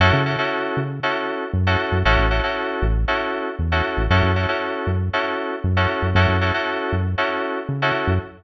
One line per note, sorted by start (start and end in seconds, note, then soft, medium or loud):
0.00 0.12 F#2 loud
0.00 0.21 C#4 medium
0.00 0.21 E4 medium
0.00 0.21 F#4 medium
0.00 0.21 A4 medium
0.13 0.36 C#3 loud
0.26 0.36 C#4 medium
0.26 0.36 E4 medium
0.26 0.36 F#4 medium
0.26 0.36 A4 medium
0.38 0.79 C#4 medium
0.38 0.79 E4 medium
0.38 0.79 F#4 medium
0.38 0.79 A4 medium
0.77 1.00 C#3 medium
1.03 1.44 C#4 medium
1.03 1.44 E4 medium
1.03 1.44 F#4 medium
1.03 1.44 A4 medium
1.53 1.76 F#2 medium
1.67 1.97 C#4 medium
1.67 1.97 E4 medium
1.67 1.97 F#4 medium
1.67 1.97 A4 medium
1.92 2.04 F#2 medium
2.05 2.17 A1 medium
2.05 2.26 C#4 medium
2.05 2.26 E4 medium
2.05 2.26 F#4 medium
2.05 2.26 A4 medium
2.18 2.41 A1 medium
2.31 2.41 C#4 medium
2.31 2.41 E4 medium
2.31 2.41 F#4 medium
2.31 2.41 A4 medium
2.43 2.85 C#4 medium
2.43 2.85 E4 medium
2.43 2.85 F#4 medium
2.43 2.85 A4 medium
2.82 3.05 A1 medium
3.08 3.49 C#4 medium
3.08 3.49 E4 medium
3.08 3.49 F#4 medium
3.08 3.49 A4 medium
3.59 3.82 E2 medium
3.72 4.02 C#4 medium
3.72 4.02 E4 medium
3.72 4.02 F#4 medium
3.72 4.02 A4 medium
3.97 4.09 A1 medium
4.10 4.22 F#2 loud
4.10 4.31 C#4 medium
4.10 4.31 E4 medium
4.10 4.31 F#4 medium
4.10 4.31 A4 medium
4.23 4.46 F#2 medium
4.36 4.46 C#4 medium
4.36 4.46 E4 medium
4.36 4.46 F#4 medium
4.36 4.46 A4 medium
4.49 4.90 C#4 medium
4.49 4.90 E4 medium
4.49 4.90 F#4 medium
4.49 4.90 A4 medium
4.87 5.10 F#2 medium
5.13 5.54 C#4 medium
5.13 5.54 E4 medium
5.13 5.54 F#4 medium
5.13 5.54 A4 medium
5.64 5.87 F#2 medium
5.77 6.07 C#4 medium
5.77 6.07 E4 medium
5.77 6.07 F#4 medium
5.77 6.07 A4 medium
6.02 6.14 F#2 medium
6.15 6.27 F#2 loud
6.15 6.36 C#4 medium
6.15 6.36 E4 medium
6.15 6.36 F#4 medium
6.15 6.36 A4 medium
6.29 6.52 F#2 medium
6.41 6.51 C#4 medium
6.41 6.51 E4 medium
6.41 6.51 F#4 medium
6.41 6.51 A4 medium
6.54 6.95 C#4 medium
6.54 6.95 E4 medium
6.54 6.95 F#4 medium
6.54 6.95 A4 medium
6.92 7.15 F#2 medium
7.18 7.59 C#4 medium
7.18 7.59 E4 medium
7.18 7.59 F#4 medium
7.18 7.59 A4 medium
7.69 7.92 C#3 medium
7.82 8.13 C#4 medium
7.82 8.13 E4 medium
7.82 8.13 F#4 medium
7.82 8.13 A4 medium
8.07 8.19 F#2 medium